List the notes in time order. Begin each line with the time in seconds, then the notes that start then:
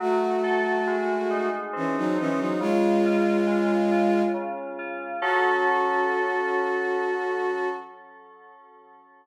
0.00 F#3 A3 F#4
0.43 A4
0.87 G#3
1.30 D#4
1.73 E3 C4 C#4
1.97 F#3 D#4
2.18 E3 C#4 D#4
2.39 F#3 D#4
2.60 C#3 G#3 F4
3.05 F4
3.47 G#3
3.91 F4
4.34 C#3
4.79 F4
5.22 F#3 C#4 F#4 A4